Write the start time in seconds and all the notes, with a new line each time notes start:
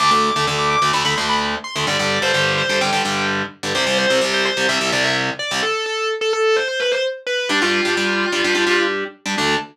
0.00 D2 D3 A3 D6
0.11 D2 D3 A3
0.23 D6
0.36 D2 D3 A3
0.47 D2 D3 A3
0.59 D6
0.70 D6
0.82 D2 D3 A3
0.93 D2 D3 A3 B5
1.05 D2 D3 A3 B5
1.17 D2 D3 A3 C6
1.29 B5
1.64 C6
1.76 D2 D3 A3
1.87 G2 D3 G3 D5
1.99 G2 D3 G3
2.22 G2 D3 G3 C5
2.34 G2 D3 G3
2.58 C5
2.69 G2 D3 G3
2.81 G2 D3 G3 G5
2.93 G2 D3 G3
3.05 G2 D3 G3
3.63 G2 D3 G3
3.75 C2 C3 G3 C5
3.87 C2 C3 G3
3.98 C5
4.10 C2 C3 G3
4.21 C2 C3 G3
4.34 C5
4.45 C5
4.57 C2 C3 G3
4.69 C2 C3 G3 E5
4.81 C2 C3 G3 E5
4.92 C2 C3 G3 D5
5.04 E5
5.39 D5
5.51 C2 C3 G3
5.62 A4
5.86 A4
6.21 A4
6.33 A4
6.56 C5
6.68 C5
6.80 B4
6.91 C5
7.27 B4
7.49 G3 D4 G4
7.62 G3 D4 F4 G4
7.85 G3 D4 G4
7.97 G3 D4 G4
8.32 G3 D4 G4
8.44 G3 D4 G4
8.55 G3 D4 G4
8.67 G3 D4 G4
9.26 G3 D4 G4
9.38 D2 D3 A3 D4